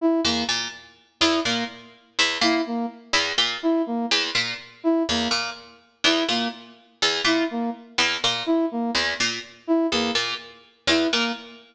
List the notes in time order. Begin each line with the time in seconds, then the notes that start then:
0.01 E4
0.25 E2 A#3
0.49 A#2
1.21 E2 E4
1.45 A#2 A#3
2.19 E2
2.41 A#2 E4
2.67 A#3
3.13 E2
3.38 A#2
3.63 E4
3.86 A#3
4.11 E2
4.35 A#2
4.84 E4
5.09 E2 A#3
5.31 A#2
6.04 E2 E4
6.29 A#2 A#3
7.02 E2
7.24 A#2 E4
7.51 A#3
7.98 E2
8.24 A#2
8.46 E4
8.71 A#3
8.95 E2
9.20 A#2
9.67 E4
9.92 E2 A#3
10.15 A#2
10.87 E2 E4
11.13 A#2 A#3